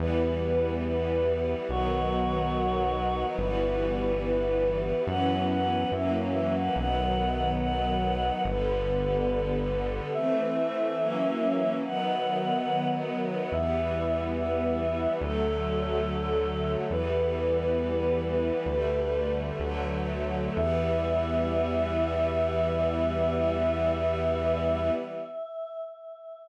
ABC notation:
X:1
M:4/4
L:1/16
Q:1/4=71
K:Em
V:1 name="Choir Aahs"
B4 B4 F8 | B4 B4 f2 f2 e z e f | f4 f4 B8 | e8 f6 z2 |
e4 e4 A8 | "^rit." B12 z4 | e16 |]
V:2 name="String Ensemble 1"
[E,G,B,]8 [^D,F,B,]8 | [E,G,B,]8 [E,F,B,^C]4 [E,F,^A,C]4 | [^D,F,B,]8 [=D,G,B,]8 | [E,A,C]4 [E,F,^A,^C]4 [^D,F,B,]8 |
[E,G,B,]8 [D,F,A,]8 | "^rit." [E,G,B,]8 [D,G,A,]4 [D,F,A,]4 | [E,G,B,]16 |]
V:3 name="Synth Bass 1" clef=bass
E,,8 B,,,8 | G,,,8 F,,4 F,,4 | B,,,8 G,,,8 | z16 |
E,,8 D,,8 | "^rit." E,,8 D,,4 D,,4 | E,,16 |]